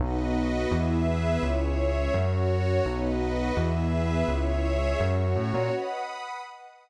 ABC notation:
X:1
M:4/4
L:1/8
Q:1/4=168
K:B
V:1 name="Pad 2 (warm)"
[B,DF]2 [B,FB]2 [B,EG]2 [B,GB]2 | [CEG]2 [G,CG]2 [CF]4 | [B,DF]2 [B,FB]2 [B,EG]2 [B,GB]2 | [CEG]2 [G,CG]2 [CF]4 |
[Bdf]2 [Bfb]2 [Bdf]2 [Bfb]2 |]
V:2 name="Pad 5 (bowed)"
[FBd]4 [GBe]4 | [Gce]4 [Fc]4 | [FBd]4 [GBe]4 | [Gce]4 [Fc]4 |
[fbd']4 [fbd']4 |]
V:3 name="Synth Bass 1" clef=bass
B,,,4 E,,4 | C,,4 F,,4 | B,,,4 E,,4 | C,,4 F,,2 =A,, ^A,, |
z8 |]